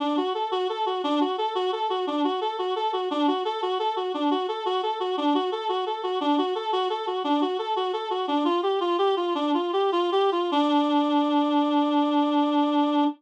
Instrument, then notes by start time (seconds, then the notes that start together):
clarinet
0.00 D4
0.17 F#4
0.34 A4
0.51 F#4
0.69 A4
0.86 F#4
1.04 D4
1.21 F#4
1.38 A4
1.55 F#4
1.72 A4
1.90 F#4
2.07 D4
2.24 F#4
2.41 A4
2.59 F#4
2.76 A4
2.93 F#4
3.11 D4
3.28 F#4
3.45 A4
3.62 F#4
3.79 A4
3.96 F#4
4.14 D4
4.31 F#4
4.48 A4
4.66 F#4
4.83 A4
5.00 F#4
5.17 D4
5.34 F#4
5.52 A4
5.69 F#4
5.86 A4
6.03 F#4
6.21 D4
6.38 F#4
6.55 A4
6.72 F#4
6.90 A4
7.07 F#4
7.24 D4
7.41 F#4
7.59 A4
7.76 F#4
7.93 A4
8.10 F#4
8.28 D4
8.45 F4
8.63 G4
8.80 F4
8.98 G4
9.16 F4
9.35 D4
9.54 F4
9.73 G4
9.92 F4
10.12 G4
10.32 F4
10.52 D4